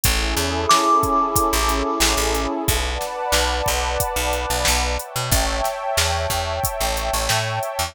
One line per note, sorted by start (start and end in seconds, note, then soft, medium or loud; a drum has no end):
0.03 0.35 A1 medium
0.03 2.62 C#4 medium
0.03 2.62 E4 medium
0.03 2.62 G#4 medium
0.03 2.62 A4 medium
0.03 kick loud
0.03 closed hi-hat loud
0.37 0.66 E2 medium
0.37 snare medium
0.37 closed hi-hat medium
0.69 2.51 D6 medium
0.69 snare loud
1.03 kick medium
1.03 closed hi-hat medium
1.36 kick medium
1.36 closed hi-hat loud
1.53 1.83 A1 medium
1.69 closed hi-hat medium
2.00 2.15 A1 medium
2.00 snare loud
2.17 2.47 A1 medium
2.34 closed hi-hat medium
2.68 2.98 B1 medium
2.68 4.87 B4 medium
2.68 4.87 D5 medium
2.68 4.87 F#5 medium
2.68 4.87 A5 medium
2.68 kick loud
2.68 closed hi-hat loud
3.01 snare medium
3.01 closed hi-hat medium
3.32 3.62 B1 medium
3.32 snare loud
3.66 3.97 B1 medium
3.66 kick medium
3.66 closed hi-hat medium
4.00 kick medium
4.00 closed hi-hat loud
4.16 4.46 B1 medium
4.33 closed hi-hat medium
4.50 4.65 B1 medium
4.65 4.97 B1 medium
4.65 snare loud
4.98 7.90 C#5 medium
4.98 7.90 E5 medium
4.98 7.90 G5 medium
4.98 7.90 A5 medium
4.98 closed hi-hat medium
5.16 5.30 B2 medium
5.31 5.61 A1 medium
5.31 kick loud
5.31 closed hi-hat loud
5.64 snare medium
5.64 closed hi-hat medium
5.97 6.27 E2 medium
5.97 snare loud
6.30 6.60 E2 medium
6.30 kick medium
6.30 closed hi-hat medium
6.64 kick medium
6.64 closed hi-hat loud
6.80 7.10 A1 medium
6.97 closed hi-hat medium
7.13 7.28 A1 medium
7.29 7.59 A2 medium
7.29 snare loud
7.63 closed hi-hat medium
7.79 7.94 E2 medium